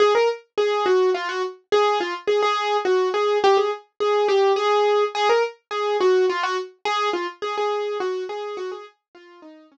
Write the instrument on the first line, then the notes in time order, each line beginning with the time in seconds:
acoustic grand piano
0.00 G#4
0.15 A#4
0.58 G#4
0.86 F#4
1.14 F4
1.29 F#4
1.72 G#4
2.00 F4
2.28 G#4
2.43 G#4
2.85 F#4
3.14 G#4
3.44 G4
3.57 G#4
4.00 G#4
4.28 G4
4.56 G#4
5.15 G#4
5.29 A#4
5.71 G#4
6.00 F#4
6.30 F4
6.43 F#4
6.85 G#4
7.13 F4
7.42 G#4
7.58 G#4
8.00 F#4
8.29 G#4
8.57 F#4
8.72 G#4
9.15 F4
9.42 D#4
9.72 C#4